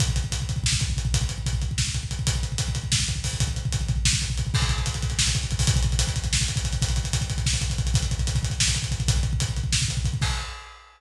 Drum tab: CC |--------------|--------------|--------------|--------------|
HH |x-x-x-x---x-x-|x-x-x-x---x-x-|x-x-x-x---x-o-|x-x-x-x---x-x-|
SD |--------o-----|--------o-----|--------o-----|--------o-----|
BD |oooooooooooooo|oooooooooooooo|oooooooooooooo|oooooooooooooo|

CC |x-------------|--------------|--------------|--------------|
HH |-xxxxxxx-xxxxo|xxxxxxxx-xxxxx|xxxxxxxx-xxxxx|xxxxxxxx-xxxxx|
SD |--------o-----|--------o-----|--------o-----|--------o-----|
BD |oooooooooooooo|oooooooooooooo|oooooooooooooo|oooooooooooooo|

CC |--------------|x-------------|
HH |x-x-x-x---x-x-|--------------|
SD |--------o-----|--------------|
BD |oooooooooooooo|o-------------|